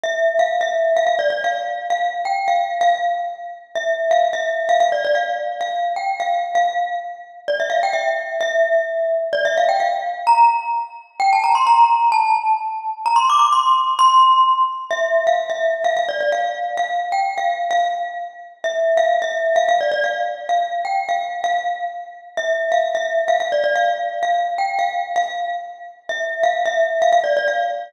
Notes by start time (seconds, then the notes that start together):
0.03 E5
0.39 F5
0.61 E5
0.97 F5
1.07 F5
1.19 D5
1.30 D5
1.44 F5
1.90 F5
2.25 G5
2.48 F5
2.81 F5
3.75 E5
4.11 F5
4.33 E5
4.69 F5
4.80 F5
4.92 D5
5.05 D5
5.15 F5
5.61 F5
5.96 G5
6.20 F5
6.55 F5
7.48 D5
7.60 E5
7.70 F5
7.83 G5
7.93 E5
8.41 E5
9.33 D5
9.45 E5
9.57 F5
9.69 G5
9.80 F5
10.27 A#5
11.20 G5
11.33 A5
11.44 A#5
11.55 C6
11.67 A#5
12.12 A5
13.06 A#5
13.16 C6
13.30 D6
13.39 D6
13.52 C6
13.99 C6
14.91 E5
15.27 F5
15.50 E5
15.84 F5
15.97 F5
16.09 D5
16.21 D5
16.32 F5
16.77 F5
17.12 G5
17.38 F5
17.71 F5
18.64 E5
18.97 F5
19.22 E5
19.56 F5
19.69 F5
19.81 D5
19.92 D5
20.04 F5
20.49 F5
20.85 G5
21.09 F5
21.44 F5
22.37 E5
22.72 F5
22.95 E5
23.28 F5
23.40 F5
23.52 D5
23.64 D5
23.76 F5
24.23 F5
24.58 G5
24.79 F5
25.16 F5
26.09 E5
26.43 F5
26.66 E5
27.02 F5
27.12 F5
27.24 D5
27.37 D5
27.48 F5